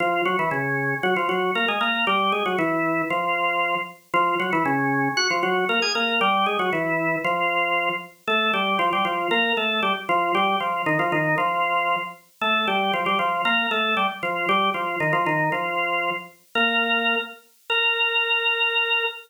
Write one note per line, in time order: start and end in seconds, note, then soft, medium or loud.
0.00 0.22 F3 medium
0.00 0.22 F4 medium
0.25 0.37 F#3 medium
0.25 0.37 F#4 medium
0.39 0.50 E3 medium
0.39 0.50 E4 medium
0.51 0.95 C#3 medium
0.51 0.95 C#4 medium
1.03 1.14 F#3 medium
1.03 1.14 F#4 medium
1.16 1.28 F3 medium
1.16 1.28 F4 medium
1.29 1.51 F#3 medium
1.29 1.51 F#4 medium
1.55 1.66 A#3 medium
1.55 1.66 A#4 medium
1.68 1.79 G#3 medium
1.68 1.79 G#4 medium
1.81 2.05 A#3 medium
1.81 2.05 A#4 medium
2.07 2.32 G3 medium
2.07 2.32 G4 medium
2.32 2.44 G#3 medium
2.32 2.44 G#4 medium
2.46 2.57 F#3 medium
2.46 2.57 F#4 medium
2.59 3.02 E3 medium
2.59 3.02 E4 medium
3.10 3.75 F3 medium
3.10 3.75 F4 medium
4.14 4.35 F3 medium
4.14 4.35 F4 loud
4.40 4.51 F#3 medium
4.40 4.51 F#4 medium
4.53 4.64 E3 medium
4.53 4.64 E4 medium
4.65 5.09 C#3 medium
4.65 5.09 C#4 medium
5.17 5.28 F#4 medium
5.17 5.28 F#5 loud
5.30 5.42 F3 medium
5.30 5.42 F4 medium
5.43 5.65 F#3 medium
5.43 5.65 F#4 medium
5.69 5.80 A#3 medium
5.69 5.80 A#4 medium
5.82 5.93 G#4 medium
5.82 5.93 G#5 medium
5.95 6.20 A#3 medium
5.95 6.20 A#4 medium
6.21 6.46 G3 medium
6.21 6.46 G4 medium
6.46 6.57 G#3 medium
6.46 6.57 G#4 medium
6.59 6.70 F#3 medium
6.59 6.70 F#4 medium
6.73 7.16 E3 medium
6.73 7.16 E4 medium
7.24 7.89 F3 medium
7.24 7.89 F4 medium
8.27 8.52 A3 medium
8.27 8.52 A4 medium
8.54 8.78 G3 medium
8.54 8.78 G4 medium
8.79 8.90 F3 medium
8.79 8.90 F4 medium
8.93 9.05 G3 medium
8.93 9.05 G4 medium
9.05 9.28 F3 medium
9.05 9.28 F4 medium
9.31 9.53 A#3 medium
9.31 9.53 A#4 medium
9.57 9.81 A3 medium
9.57 9.81 A4 medium
9.83 9.93 G3 medium
9.83 9.93 G4 medium
10.09 10.32 F3 medium
10.09 10.32 F4 medium
10.35 10.56 G3 medium
10.35 10.56 G4 medium
10.60 10.82 F3 medium
10.60 10.82 F4 medium
10.86 10.98 D#3 medium
10.86 10.98 D#4 medium
10.99 11.11 F3 medium
10.99 11.11 F4 medium
11.12 11.36 D#3 medium
11.12 11.36 D#4 medium
11.38 11.96 F3 medium
11.38 11.96 F4 medium
12.41 12.66 A3 medium
12.41 12.66 A4 medium
12.68 12.92 G3 medium
12.68 12.92 G4 medium
12.93 13.04 F3 medium
12.93 13.04 F4 medium
13.06 13.18 G3 medium
13.06 13.18 G4 medium
13.19 13.42 F3 medium
13.19 13.42 F4 medium
13.45 13.67 A#3 medium
13.45 13.67 A#4 medium
13.71 13.95 A3 medium
13.71 13.95 A4 medium
13.97 14.07 G3 medium
13.97 14.07 G4 medium
14.23 14.46 F3 medium
14.23 14.46 F4 medium
14.49 14.70 G3 medium
14.49 14.70 G4 medium
14.74 14.96 F3 medium
14.74 14.96 F4 medium
15.00 15.12 D#3 medium
15.00 15.12 D#4 medium
15.13 15.25 F3 medium
15.13 15.25 F4 medium
15.26 15.50 D#3 medium
15.26 15.50 D#4 medium
15.52 16.10 F3 medium
15.52 16.10 F4 medium
16.55 17.16 A#3 medium
16.55 17.16 A#4 medium
17.70 19.03 A#4 loud